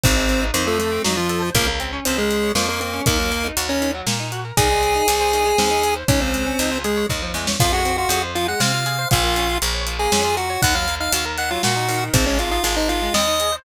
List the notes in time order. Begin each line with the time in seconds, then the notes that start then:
0.03 G#1 D#3 C4 C5, kick, closed hi-hat
0.16 G#3
0.29 C4, closed hi-hat
0.41 D#4
0.54 F2 D#3 C4 C5, closed hi-hat
0.67 F3 A3 A4
0.79 A3 A4, closed hi-hat
0.92 C4
1.04 F2 F#3 D#4 F#4, snare
1.17 F3 F4
1.29 A4, closed hi-hat
1.42 C5
1.55 C#2 F3 A#3 A#4, kick, closed hi-hat
1.67 A#3
1.80 C4, closed hi-hat
1.93 C#4
2.05 C#2 C4 F4 C5, closed hi-hat
2.18 G#3 G#4 A#4
2.30 C5, closed hi-hat
2.43 C#5
2.55 F2 F3 A#3 A#4, snare
2.68 A#3 A#4
2.81 A#3 C4 A#4, closed hi-hat
2.93 C#4
3.06 D#2 D#3 A#3 A#4, kick, closed hi-hat
3.19 F#3
3.31 A#3, closed hi-hat
3.44 D#4
3.57 D#2 F#4, closed hi-hat
3.69 C#4 A#4 C#5
3.82 D#3, closed hi-hat
3.94 F#3
4.07 A#2 A#3, snare
4.20 D#4
4.32 F#4, closed hi-hat
4.45 A#4
4.57 C2 D#3 G#4 G#5, kick, closed hi-hat
4.70 G#3
4.83 C4, closed hi-hat
4.95 D#4
5.08 C2 G#4, closed hi-hat
5.20 C5
5.33 D#3, closed hi-hat
5.46 G#3
5.58 D#2 C4, snare
5.71 D#4
5.83 G#4, closed hi-hat
5.96 C5
6.08 C#2 D#3 C#4 C#5, kick, closed hi-hat
6.21 F3 C4 C5
6.34 G#3, closed hi-hat
6.46 C#4
6.59 C#2 D#4, closed hi-hat
6.72 F4
6.84 G#3 G#4, closed hi-hat
6.97 C#5
7.09 D#2 D#3, kick, snare
7.22 F3
7.34 E2 G#3, snare
7.47 C#4, snare
7.60 F2 F3 F4 F5, kick, crash
7.72 G#3 F#4 F#5
7.85 C4, closed hi-hat
7.98 F4 F#4 F#5
8.09 F2 F#4 G#4 F#5, closed hi-hat
8.23 C5
8.35 F3 F4 F5, closed hi-hat
8.48 G#3 F#5 F#6
8.60 C3 C4 F5 F6, snare
8.73 F4
8.86 G#4, closed hi-hat
8.99 C5
9.11 A#1 F3 F4 F5, kick, closed hi-hat
9.24 A#3
9.36 C#4, closed hi-hat
9.49 F4
9.62 A#1 A#4, closed hi-hat
9.74 C#5
9.87 F3, closed hi-hat
9.99 A#3 G#4 G#5
10.12 F2 C#4, snare
10.25 F4
10.37 F#4 A#4 F#5, closed hi-hat
10.50 C#5
10.62 D#2 D#3 F#5 F#6, kick, closed hi-hat
10.75 F#3 F5 F6
10.88 A#3, closed hi-hat
11.00 D#4 F5 F6
11.13 D#2 F#4 F5 F6, closed hi-hat
11.25 A#4
11.38 D#3 F#5 F#6, closed hi-hat
11.51 F#3 F4 F5
11.63 A#2 A#3 F#4 F#5, snare
11.76 D#4
11.88 D#3, open hi-hat
12.13 G#1 C4 C5, kick, closed hi-hat
12.26 G#3 C#4 C#5
12.39 C4 F4 F5, closed hi-hat
12.51 D#4 F4 F5
12.64 G#1 F4 G#4 F5, closed hi-hat
12.77 D#4 C5 D#5
12.89 D#3 F4 F5, closed hi-hat
13.02 G#3
13.14 D#2 C4 D#5 D#6, snare
13.27 D#4
13.40 G#4, closed hi-hat
13.52 C5